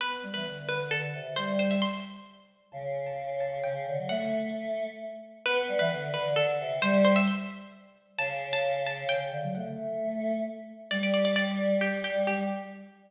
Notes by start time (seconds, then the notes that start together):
0.00 B3 B4
0.23 G3
0.34 E3 B4
0.45 D3
0.68 D3 B4
0.91 D3 A4
1.14 C3
1.36 G3 C5
1.59 C5
1.71 E5
1.82 C6
2.72 C#3 A5
3.06 A5
3.40 A5
3.64 C#3 G5
3.86 D3
3.98 F#3
4.09 A3 F#5
5.45 B3 B4
5.68 G3
5.79 E3 B4
5.91 D3
6.14 D3 B4
6.36 D3 A4
6.59 C3
6.82 G3 C5
7.05 C5
7.16 E5
7.27 C6
8.18 C#3 A5
8.53 A5
8.86 A5
9.09 C#3 G5
9.32 D3
9.43 F#3
9.55 A3 F#5
10.91 G3 D5
11.03 D5
11.14 D5
11.25 D5
11.36 D5
11.81 G4
12.04 G4
12.27 G3 G4